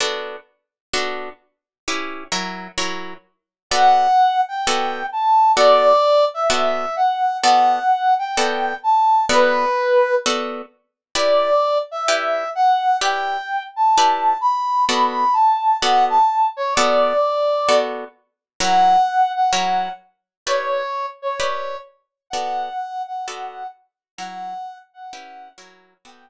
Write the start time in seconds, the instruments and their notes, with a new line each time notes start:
0.00 acoustic guitar (steel) B3 D4 F#4 A4
0.94 acoustic guitar (steel) B3 D4 F#4 A4
1.88 acoustic guitar (steel) C#4 E4 G4 B4
2.32 acoustic guitar (steel) F#3 E4 A#4 C#5
2.78 acoustic guitar (steel) F#3 E4 A#4 C#5
3.71 acoustic guitar (steel) B3 F#4 A4 D5, brass section F#5
4.48 brass section G5
4.67 acoustic guitar (steel) B3 F#4 A4 D5
5.12 brass section A5
5.56 acoustic guitar (steel) B3 F#4 A4 D5, brass section D5
6.34 brass section E5
6.50 acoustic guitar (steel) B3 F#4 A4 D5
6.96 brass section F#5
7.42 acoustic guitar (steel) B3 F#4 A4 D5, brass section F#5
8.19 brass section G5
8.37 acoustic guitar (steel) B3 F#4 A4 D5
8.83 brass section A5
9.29 acoustic guitar (steel) B3 F#4 A4 D5, brass section B4
10.26 acoustic guitar (steel) B3 F#4 A4 D5
11.15 acoustic guitar (steel) E4 G4 B4 D5, brass section D5
11.91 brass section E5
12.08 acoustic guitar (steel) E4 G4 B4 D5
12.55 brass section F#5
13.01 acoustic guitar (steel) E4 G4 B4 D5, brass section G5
13.76 brass section A5
13.98 acoustic guitar (steel) E4 G4 B4 D5
14.41 brass section B5
14.89 acoustic guitar (steel) B3 F#4 A4 D5, brass section B5
15.33 brass section A5
15.81 acoustic guitar (steel) B3 F#4 A4 D5, brass section F#5
16.10 brass section A5
16.57 brass section C#5
16.74 acoustic guitar (steel) B3 F#4 A4 D5, brass section D5
17.69 acoustic guitar (steel) B3 F#4 A4 D5
18.60 acoustic guitar (steel) F#3 E4 A#4 C#5, brass section F#5
19.35 brass section F#5
19.53 acoustic guitar (steel) F#3 E4 A#4 C#5
20.47 acoustic guitar (steel) E4 G4 B4 D5, brass section C#5
21.22 brass section C#5
21.40 acoustic guitar (steel) E4 G4 B4 D5
22.30 acoustic guitar (steel) B3 F#4 A4 D5, brass section F#5
23.07 brass section F#5
23.28 acoustic guitar (steel) B3 F#4 A4 D5
24.18 acoustic guitar (steel) F#3 E4 A#4 C#5, brass section F#5
24.94 brass section F#5
25.13 acoustic guitar (steel) C#4 E4 G4 B4
25.58 acoustic guitar (steel) F#3 E4 A#4 C#5
26.05 acoustic guitar (steel) B3 F#4 A4 D5, brass section G5